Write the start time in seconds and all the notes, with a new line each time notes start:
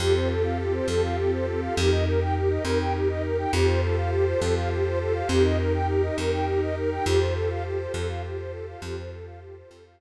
0.00 F2 C4 F4 G4 A4
0.15 C5
0.30 A4
0.44 F5
0.59 G4
0.74 C5
0.88 F2 A4
1.03 F5
1.18 G4
1.32 C5
1.47 A4
1.62 F5
1.76 F2 D#4 G4 A#4
1.91 D#5
2.06 A#4
2.21 G5
2.35 G4
2.50 D#5
2.65 F2 A#4
2.79 G5
2.94 G4
3.09 D#5
3.24 A#4
3.38 G5
3.53 F2 F4 G4 A4 C5
3.68 C5
3.82 A4
3.97 F5
4.12 G4
4.27 C5
4.41 F2 A4
4.56 F5
4.71 G4
4.85 C5
5.00 A4
5.15 F5
5.29 F2 D#4 G4 A#4
5.44 D#5
5.59 A#4
5.74 G5
5.88 G4
6.03 D#5
6.18 F2 A#4
6.32 G5
6.47 G4
6.62 D#5
6.76 A#4
6.91 G5
7.06 F2 F4 G4 A4 C5
7.20 C5
7.35 A4
7.50 F5
7.65 G4
7.80 C5
7.94 F2 A4
8.09 F5
8.23 G4
8.38 C5
8.53 A4
8.68 F5
8.82 F2 F4 G4 A4 C5
8.97 C5
9.12 A4
9.26 F5
9.41 G4
9.56 C5
9.70 F2 A4
9.85 F5